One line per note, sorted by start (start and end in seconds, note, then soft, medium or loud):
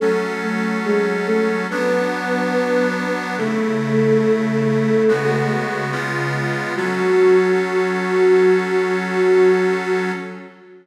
0.00 1.67 F#3 medium
0.00 0.35 A3 medium
0.00 1.67 C#4 loud
0.00 0.35 A4 medium
0.00 1.67 A4 medium
0.42 0.78 A3 medium
0.42 0.78 A4 medium
0.85 1.25 G#3 medium
0.85 1.25 G#4 medium
1.26 1.61 A3 medium
1.26 1.61 A4 medium
1.69 3.36 F#3 loud
1.69 3.12 B3 medium
1.69 3.36 B3 loud
1.69 3.36 D4 loud
1.69 3.12 B4 medium
3.38 5.03 C#3 loud
3.38 5.03 A3 medium
3.38 5.49 A3 medium
3.38 5.03 E4 loud
3.38 5.49 A4 medium
5.08 5.91 C#3 loud
5.08 5.91 G#3 loud
5.08 5.91 B3 medium
5.08 5.91 F#4 loud
5.92 6.75 C#3 loud
5.92 6.75 G#3 loud
5.92 6.75 B3 loud
5.92 6.75 F4 loud
6.75 10.12 F#3 loud
6.75 10.12 C#4 medium
6.75 10.10 F#4 loud
6.75 10.12 A4 loud